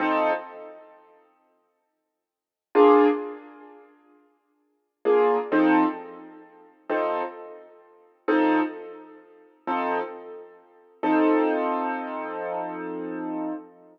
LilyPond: \new Staff { \time 12/8 \key f \major \tempo 4. = 87 <f c' ees' a'>1. | <bes d' f' aes'>1~ <bes d' f' aes'>4 <bes d' f' aes'>4 | <f c' ees' a'>2. <f c' ees' a'>2. | <f c' ees' a'>2. <f c' ees' a'>2. |
<f c' ees' a'>1. | }